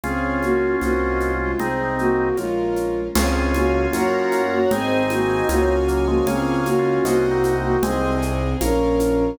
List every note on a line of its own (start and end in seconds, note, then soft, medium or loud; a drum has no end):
0.04 0.75 C#2 medium
0.04 0.39 C4 medium
0.04 0.81 C#4 medium
0.04 1.52 C#4 medium
0.04 0.81 F4 medium
0.04 1.52 F4 medium
0.04 0.39 G#4 medium
0.04 0.81 G#4 medium
0.04 0.74 C#5 medium
0.04 0.74 F5 medium
0.04 0.74 G#5 medium
0.04 low conga medium
0.04 shaker medium
0.43 0.76 A#3 medium
0.43 0.76 F#4 medium
0.43 high conga medium
0.43 shaker medium
0.81 1.54 C2 medium
0.81 1.32 A#3 medium
0.81 1.59 C4 medium
0.81 1.59 D#4 medium
0.81 1.32 F#4 medium
0.81 1.59 F#4 medium
0.81 1.52 C5 medium
0.81 1.52 D#5 medium
0.81 1.52 F#5 loud
0.81 high conga medium
0.81 shaker medium
1.20 high conga medium
1.20 shaker medium
1.40 1.59 G#3 medium
1.40 1.59 F4 medium
1.59 2.31 C2 medium
1.59 1.95 C4 medium
1.59 2.28 C4 medium
1.59 2.37 C4 medium
1.59 2.28 D#4 medium
1.59 2.37 D#4 medium
1.59 1.95 G#4 medium
1.59 2.37 G#4 medium
1.59 2.30 C5 medium
1.59 2.30 D#5 medium
1.59 2.30 G#5 medium
1.59 low conga loud
1.59 shaker medium
1.99 2.37 A#3 medium
1.99 2.37 F#4 medium
1.99 shaker medium
2.37 3.09 A#1 medium
2.37 3.00 G#3 medium
2.37 3.15 A#3 medium
2.37 3.15 C#4 medium
2.37 3.00 F4 medium
2.37 3.15 F4 medium
2.37 3.08 A#4 loud
2.37 3.08 C#5 medium
2.37 3.08 F5 medium
2.37 high conga medium
2.37 shaker medium
2.76 high conga medium
2.76 shaker medium
3.15 3.87 C#2 loud
3.15 3.52 C4 medium
3.15 4.59 C#4 medium
3.15 3.86 C#4 loud
3.15 4.59 F4 medium
3.15 3.86 F4 loud
3.15 3.52 G#4 medium
3.15 3.86 G#4 loud
3.15 3.93 C#5 loud
3.15 3.93 F5 loud
3.15 3.93 G#5 loud
3.15 crash loud
3.15 low conga loud
3.15 shaker loud
3.54 3.86 A#3 medium
3.54 3.86 F#4 medium
3.54 high conga loud
3.54 shaker medium
3.93 4.66 F#2 loud
3.93 4.42 A#3 medium
3.93 4.63 C#4 loud
3.93 4.42 F#4 medium
3.93 4.63 F#4 loud
3.93 4.63 A#4 loud
3.93 4.70 C#5 loud
3.93 4.70 F#5 loud
3.93 4.70 A#5 medium
3.93 high conga loud
3.93 shaker loud
4.32 high conga medium
4.32 shaker medium
4.52 4.70 A#3 medium
4.52 4.70 F#4 medium
4.71 5.43 G#1 loud
4.71 5.03 C4 medium
4.71 5.76 C4 medium
4.71 5.41 C4 loud
4.71 5.76 D#4 medium
4.71 5.41 D#4 loud
4.71 5.03 G#4 loud
4.71 5.41 G#4 loud
4.71 5.48 C5 loud
4.71 5.48 D#5 loud
4.71 5.48 G#5 loud
4.71 low conga loud
4.71 shaker medium
5.10 5.48 A#3 medium
5.10 5.48 F#4 medium
5.10 high conga loud
5.10 shaker medium
5.49 6.21 C#2 loud
5.49 6.06 A#3 medium
5.49 6.19 C#4 loud
5.49 6.19 F4 loud
5.49 6.06 F#4 loud
5.49 6.19 G#4 loud
5.49 6.26 C#5 loud
5.49 6.26 F5 medium
5.49 6.26 G#5 loud
5.49 high conga loud
5.49 shaker loud
5.88 6.07 F#3 medium
5.88 6.07 A#3 medium
5.88 shaker medium
6.07 6.26 F3 medium
6.07 6.26 G#3 medium
6.07 6.26 A#3 medium
6.07 6.26 F#4 loud
6.27 6.99 C#2 loud
6.27 6.69 A#3 medium
6.27 6.60 C4 medium
6.27 6.69 C#4 medium
6.27 7.04 C#4 loud
6.27 7.04 F4 loud
6.27 7.04 G#4 loud
6.27 6.60 G#4 loud
6.27 6.97 C#5 loud
6.27 6.97 F5 loud
6.27 6.97 G#5 loud
6.27 low conga loud
6.27 shaker medium
6.66 7.03 A#3 medium
6.66 7.03 F#4 medium
6.66 high conga medium
6.66 shaker medium
6.79 7.26 C#4 medium
6.79 7.26 F4 medium
7.05 7.76 C2 loud
7.05 7.55 A#3 medium
7.05 7.82 C4 loud
7.05 7.82 D#4 loud
7.05 7.82 F#4 loud
7.05 7.55 F#4 medium
7.05 7.75 C5 loud
7.05 7.75 D#5 loud
7.05 7.75 F#5 loud
7.05 high conga loud
7.05 shaker loud
7.31 7.77 C4 medium
7.31 7.77 D#4 medium
7.44 high conga medium
7.44 shaker loud
7.63 7.82 A#3 medium
7.63 7.82 F#4 medium
7.83 8.54 C2 loud
7.83 8.17 G#3 medium
7.83 8.17 C4 medium
7.83 8.21 C4 medium
7.83 8.60 C4 loud
7.83 8.60 D#4 medium
7.83 8.21 G#4 loud
7.83 8.60 G#4 loud
7.83 8.53 C5 loud
7.83 8.53 D#5 loud
7.83 8.53 G#5 loud
7.83 low conga loud
7.83 shaker loud
8.22 8.57 C4 medium
8.22 8.57 G#4 medium
8.22 shaker medium
8.61 9.33 A#1 loud
8.61 9.38 A#3 medium
8.61 9.38 C#4 medium
8.61 9.36 C#4 medium
8.61 9.38 F4 loud
8.61 9.31 A#4 loud
8.61 9.36 A#4 medium
8.61 9.31 C#5 loud
8.61 9.31 F5 loud
8.61 high conga loud
8.61 shaker loud
9.00 high conga medium
9.00 shaker loud